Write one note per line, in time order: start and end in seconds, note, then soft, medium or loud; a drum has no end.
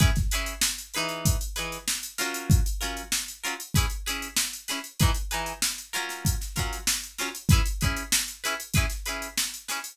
0.00 0.10 C#4 medium
0.00 0.10 E4 loud
0.00 0.10 G#4 loud
0.00 0.10 B4 loud
0.00 kick loud
0.00 closed hi-hat medium
0.16 kick medium
0.16 snare soft
0.16 closed hi-hat medium
0.31 0.54 C#4 medium
0.31 0.54 E4 medium
0.31 0.54 G#4 medium
0.31 0.54 B4 medium
0.31 closed hi-hat medium
0.46 closed hi-hat medium
0.61 snare loud
0.78 closed hi-hat medium
0.94 1.37 E3 loud
0.94 1.37 D#4 loud
0.94 1.37 G#4 medium
0.94 1.37 B4 medium
0.94 closed hi-hat medium
1.09 closed hi-hat medium
1.25 kick medium
1.25 closed hi-hat loud
1.41 closed hi-hat medium
1.56 1.78 E3 medium
1.56 1.78 D#4 medium
1.56 1.78 G#4 medium
1.56 1.78 B4 medium
1.56 closed hi-hat medium
1.72 closed hi-hat medium
1.88 snare loud
2.03 closed hi-hat medium
2.18 2.61 F#3 loud
2.18 2.61 C#4 medium
2.18 2.61 F4 medium
2.18 2.61 A#4 medium
2.18 snare medium
2.18 closed hi-hat medium
2.34 closed hi-hat medium
2.50 kick loud
2.50 closed hi-hat medium
2.66 closed hi-hat medium
2.81 3.02 F#3 medium
2.81 3.02 C#4 medium
2.81 3.02 F4 medium
2.81 3.02 A#4 medium
2.81 closed hi-hat medium
2.97 closed hi-hat medium
3.12 snare loud
3.28 closed hi-hat medium
3.43 3.54 F#3 medium
3.43 3.54 C#4 medium
3.43 3.54 F4 medium
3.43 3.54 A#4 medium
3.43 closed hi-hat medium
3.60 closed hi-hat medium
3.74 3.86 C#4 medium
3.74 3.86 E4 medium
3.74 3.86 G#4 loud
3.74 3.86 B4 loud
3.74 kick medium
3.74 closed hi-hat loud
3.90 closed hi-hat medium
4.06 4.28 C#4 medium
4.06 4.28 E4 medium
4.06 4.28 G#4 medium
4.06 4.28 B4 medium
4.06 closed hi-hat medium
4.22 closed hi-hat medium
4.36 snare loud
4.53 closed hi-hat medium
4.68 4.79 C#4 medium
4.68 4.79 E4 medium
4.68 4.79 G#4 medium
4.68 4.79 B4 medium
4.68 snare medium
4.68 closed hi-hat medium
4.84 closed hi-hat medium
4.99 5.11 E3 loud
4.99 5.11 D#4 medium
4.99 5.11 G#4 loud
4.99 5.11 B4 loud
4.99 kick loud
4.99 closed hi-hat loud
5.14 closed hi-hat medium
5.31 5.53 E3 medium
5.31 5.53 D#4 medium
5.31 5.53 G#4 medium
5.31 5.53 B4 medium
5.31 closed hi-hat medium
5.46 closed hi-hat medium
5.62 snare loud
5.78 closed hi-hat medium
5.93 6.35 F#3 medium
5.93 6.35 C#4 medium
5.93 6.35 F4 medium
5.93 6.35 A#4 medium
5.93 closed hi-hat medium
6.09 snare soft
6.09 closed hi-hat medium
6.25 kick medium
6.25 closed hi-hat loud
6.41 snare soft
6.41 closed hi-hat medium
6.56 6.78 F#3 medium
6.56 6.78 C#4 medium
6.56 6.78 F4 medium
6.56 6.78 A#4 medium
6.56 kick medium
6.56 snare soft
6.56 closed hi-hat medium
6.73 closed hi-hat medium
6.87 snare loud
7.04 closed hi-hat medium
7.18 7.29 F#3 medium
7.18 7.29 C#4 medium
7.18 7.29 F4 medium
7.18 7.29 A#4 medium
7.18 snare medium
7.18 closed hi-hat medium
7.35 closed hi-hat medium
7.49 7.61 E4 loud
7.49 7.61 G#4 medium
7.49 7.61 B4 loud
7.49 kick loud
7.49 closed hi-hat loud
7.53 7.61 C#4 medium
7.65 closed hi-hat medium
7.81 8.03 C#4 medium
7.81 8.03 E4 medium
7.81 8.03 G#4 medium
7.81 8.03 B4 medium
7.81 kick medium
7.81 closed hi-hat medium
7.96 closed hi-hat medium
8.12 snare loud
8.28 closed hi-hat medium
8.44 8.55 C#4 medium
8.44 8.55 E4 medium
8.44 8.55 G#4 medium
8.44 8.55 B4 medium
8.44 closed hi-hat medium
8.60 closed hi-hat medium
8.74 8.86 E4 loud
8.74 8.86 G#4 medium
8.74 8.86 B4 loud
8.74 kick medium
8.74 closed hi-hat loud
8.78 8.86 C#4 loud
8.90 snare soft
8.90 closed hi-hat medium
9.06 9.28 C#4 medium
9.06 9.28 E4 medium
9.06 9.28 G#4 medium
9.06 9.28 B4 medium
9.06 closed hi-hat medium
9.22 closed hi-hat medium
9.38 snare loud
9.54 closed hi-hat medium
9.68 9.79 C#4 medium
9.68 9.79 E4 medium
9.68 9.79 G#4 medium
9.68 9.79 B4 medium
9.68 snare medium
9.68 closed hi-hat medium
9.84 closed hi-hat medium